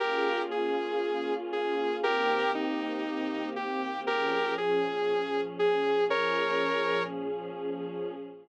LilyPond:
<<
  \new Staff \with { instrumentName = "Lead 2 (sawtooth)" } { \time 4/4 \key bes \dorian \tempo 4 = 118 <g' bes'>4 aes'2 aes'4 | <g' bes'>4 ees'2 g'4 | <g' bes'>4 aes'2 aes'4 | <bes' des''>2 r2 | }
  \new Staff \with { instrumentName = "Pad 2 (warm)" } { \time 4/4 \key bes \dorian <bes des' f' aes'>1 | <ees bes c' g'>1 | <bes, f des' aes'>1 | <bes, f des' aes'>1 | }
>>